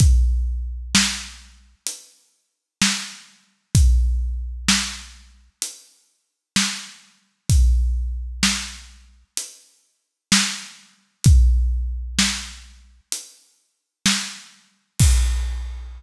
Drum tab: CC |--------|--------|--------|--------|
HH |x---x---|x---x---|x---x---|x---x---|
SD |--o---o-|--o---o-|--o---o-|--o---o-|
BD |o-------|o-------|o-------|o-------|

CC |x-------|
HH |--------|
SD |--------|
BD |o-------|